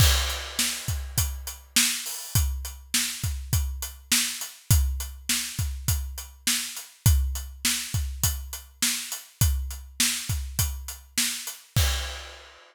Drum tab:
CC |x-------|--------|--------|--------|
HH |-x-xxx-o|xx-xxx-x|xx-xxx-x|xx-xxx-x|
SD |--o---o-|--o---o-|--o---o-|--o---o-|
BD |o--oo---|o--oo---|o--oo---|o--oo---|

CC |--------|x-------|
HH |xx-xxx-x|--------|
SD |--o---o-|--------|
BD |o--oo---|o-------|